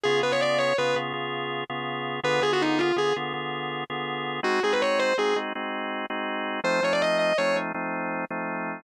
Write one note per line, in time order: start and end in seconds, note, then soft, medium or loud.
0.04 0.22 C#3 loud
0.04 0.22 B3 loud
0.04 0.22 F4 loud
0.04 0.19 G#4 medium
0.04 0.22 G#4 loud
0.23 0.73 C#3 medium
0.23 0.73 B3 loud
0.23 0.73 F4 medium
0.23 0.73 G#4 loud
0.23 0.32 B4 medium
0.32 0.41 C#5 medium
0.41 0.57 D5 medium
0.58 0.75 C#5 medium
0.78 0.95 C#3 loud
0.78 0.95 B3 medium
0.78 0.95 F4 loud
0.78 0.95 G#4 loud
0.78 0.95 B4 medium
0.96 1.13 C#3 loud
0.96 1.13 B3 loud
0.96 1.13 F4 loud
0.96 1.13 G#4 medium
1.13 1.64 C#3 medium
1.13 1.64 B3 medium
1.13 1.64 F4 loud
1.13 1.64 G#4 loud
1.70 2.20 C#3 medium
1.70 2.20 B3 loud
1.70 2.20 F4 loud
1.70 2.20 G#4 medium
2.23 2.40 D3 loud
2.23 2.40 B3 loud
2.23 2.40 F4 loud
2.23 2.40 G#4 loud
2.23 2.41 B4 medium
2.41 2.92 D3 medium
2.41 2.92 B3 loud
2.41 2.92 F4 loud
2.41 2.92 G#4 loud
2.41 2.51 G#4 medium
2.53 2.62 F#4 medium
2.62 2.80 D#4 medium
2.79 2.95 F4 medium
2.96 3.13 D3 medium
2.96 3.13 B3 medium
2.96 3.13 F4 loud
2.96 3.13 G#4 medium
3.16 3.33 D3 medium
3.16 3.33 B3 loud
3.16 3.33 F4 loud
3.16 3.33 G#4 loud
3.33 3.84 D3 medium
3.33 3.84 B3 medium
3.33 3.84 F4 loud
3.33 3.84 G#4 medium
3.90 4.40 D3 medium
3.90 4.40 B3 loud
3.90 4.40 F4 medium
3.90 4.40 G#4 loud
4.43 4.60 G#3 loud
4.43 4.60 C4 loud
4.43 4.60 D#4 loud
4.43 4.60 F#4 loud
4.43 4.60 F#4 medium
4.63 5.14 G#3 loud
4.63 5.14 C4 medium
4.63 5.14 D#4 loud
4.63 5.14 F#4 loud
4.63 4.72 G#4 medium
4.73 4.81 B4 medium
4.82 4.98 C#5 medium
4.99 5.15 C5 medium
5.18 5.35 G#3 medium
5.18 5.35 C4 loud
5.18 5.35 D#4 loud
5.18 5.35 F#4 medium
5.18 5.36 G#4 medium
5.36 5.53 G#3 medium
5.36 5.53 C4 medium
5.36 5.53 D#4 loud
5.36 5.53 F#4 medium
5.55 6.06 G#3 medium
5.55 6.06 C4 loud
5.55 6.06 D#4 medium
5.55 6.06 F#4 medium
6.10 6.60 G#3 medium
6.10 6.60 C4 loud
6.10 6.60 D#4 loud
6.10 6.60 F#4 loud
6.64 6.81 F3 loud
6.64 6.81 A3 loud
6.64 6.81 C4 loud
6.64 6.81 D#4 loud
6.64 6.82 C5 medium
6.82 7.33 F3 loud
6.82 7.33 A3 loud
6.82 7.33 C4 medium
6.82 7.33 D#4 medium
6.82 6.93 C#5 medium
6.93 7.02 D5 medium
7.02 7.17 D#5 medium
7.19 7.37 D#5 medium
7.38 7.55 F3 medium
7.38 7.55 A3 loud
7.38 7.55 C4 loud
7.38 7.55 D#4 medium
7.38 7.56 C#5 medium
7.55 7.72 F3 loud
7.55 7.72 A3 loud
7.55 7.72 C4 medium
7.55 7.72 D#4 loud
7.74 8.25 F3 loud
7.74 8.25 A3 loud
7.74 8.25 C4 loud
7.74 8.25 D#4 loud
8.31 8.81 F3 loud
8.31 8.81 A3 loud
8.31 8.81 C4 medium
8.31 8.81 D#4 medium